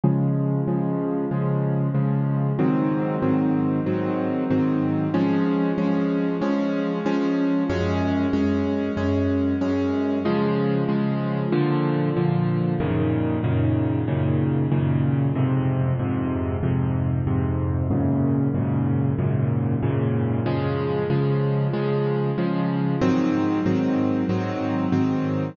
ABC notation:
X:1
M:4/4
L:1/8
Q:1/4=94
K:Db
V:1 name="Acoustic Grand Piano"
[D,F,A,]2 [D,F,A,]2 [D,F,A,]2 [D,F,A,]2 | [A,,E,G,C]2 [A,,E,G,C]2 [A,,E,G,C]2 [A,,E,G,C]2 | [F,A,D]2 [F,A,D]2 [F,A,D]2 [F,A,D]2 | [G,,A,D]2 [G,,A,D]2 [G,,A,D]2 [G,,A,D]2 |
[D,F,A,]2 [D,F,A,]2 [B,,=D,F,]2 [B,,D,F,]2 | [G,,B,,D,E,]2 [G,,B,,D,E,]2 [G,,B,,D,E,]2 [G,,B,,D,E,]2 | [F,,A,,C,]2 [F,,A,,C,]2 [F,,A,,C,]2 [F,,A,,C,]2 | [G,,A,,B,,D,]2 [G,,A,,B,,D,]2 [G,,A,,B,,D,]2 [G,,A,,B,,D,]2 |
[D,F,A,]2 [D,F,A,]2 [D,F,A,]2 [D,F,A,]2 | [A,,E,G,C]2 [A,,E,G,C]2 [A,,E,G,C]2 [A,,E,G,C]2 |]